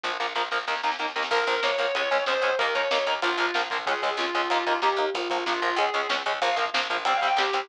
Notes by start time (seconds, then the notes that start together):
0.04 A#1 F3 A#3, kick, snare
0.20 A#1 F3 A#3, snare
0.35 A#1 F3 A#3, snare
0.51 A#1 F3 A#3, snare
0.67 D#2 D#3 A#3, snare
0.75 snare
0.83 D#2 D#3 A#3, snare
0.91 snare
0.99 D#2 D#3 A#3, snare
1.08 snare
1.15 D#2 D#3 A#3, snare
1.22 snare
1.31 A#1 F3 A#3 A#4, kick, crash
1.39 kick
1.47 A#1 F3 A#3, kick, closed hi-hat
1.56 kick
1.63 A#1 F3 A#3 C#5, kick, snare
1.71 kick
1.78 A#1 F3 A#3, kick, closed hi-hat
1.87 kick
1.95 C#2 G#3 C#4, kick, closed hi-hat
2.04 kick
2.11 C#2 G#3 C#4, kick, closed hi-hat
2.19 kick
2.26 C#2 G#3 C#4 C5, kick, snare
2.35 kick
2.42 C#2 G#3 C#4, kick, closed hi-hat
2.51 kick
2.59 D#2 A#3 D#4 A#4, kick, closed hi-hat
2.66 kick
2.75 D#2 A#3 D#4 C#5, kick, closed hi-hat
2.82 kick
2.91 D#2 A#3 D#4, kick, snare
2.98 kick
3.07 D#2 A#3 D#4, kick, closed hi-hat
3.15 kick
3.22 A#1 F3 A#3 F4, kick, closed hi-hat
3.32 kick
3.37 A#1 F3 A#3, kick, closed hi-hat
3.46 kick
3.54 A#1 F3 A#3, kick, snare
3.63 kick
3.70 A#1 F3 A#3, kick, closed hi-hat
3.79 kick
3.86 C#2 G#3 C#4 G#4, kick, closed hi-hat
3.95 kick
4.02 C#2 G#3 C#4, kick, closed hi-hat
4.11 kick
4.17 C#2 G#3 C#4 F4, kick, snare
4.26 kick
4.34 C#2 G#3 C#4, kick, closed hi-hat
4.43 kick
4.50 D#2 A#3 D#4, kick, closed hi-hat
4.59 kick
4.66 D#2 A#3 D#4, kick, closed hi-hat
4.74 kick
4.82 D#2 A#3 D#4 G4, kick, snare
4.90 kick
4.96 D#2 A#3 D#4, kick, closed hi-hat
5.07 kick
5.14 A#1 F3 A#3 F4, kick, closed hi-hat
5.22 kick
5.30 A#1 F3 A#3, kick, closed hi-hat
5.38 kick
5.46 A#1 F3 A#3 F4, kick, snare
5.54 kick
5.62 A#1 F3 A#3, kick, closed hi-hat
5.71 kick
5.76 C#2 G#3 C#4 G#4, kick, closed hi-hat
5.86 kick
5.94 C#2 G#3 C#4, kick, closed hi-hat
6.02 kick
6.09 C#2 G#3 C#4, kick, snare
6.18 kick
6.26 C#2 G#3 C#4, kick, closed hi-hat
6.34 kick
6.41 A#1 F3 A#3 F5, kick, closed hi-hat
6.49 kick
6.56 A#1 F3 A#3, kick, closed hi-hat
6.66 kick
6.74 A#1 F3 A#3, kick, snare
6.82 kick
6.90 A#1 F3 A#3, kick, closed hi-hat
6.97 kick
7.05 C2 G3 C4 G5, kick, closed hi-hat
7.14 F5, kick
7.21 C2 G3 C4, kick, closed hi-hat
7.27 G5, kick
7.37 C2 G3 C4 G4, kick, snare
7.46 kick
7.53 C2 G3 C4, kick, closed hi-hat
7.61 kick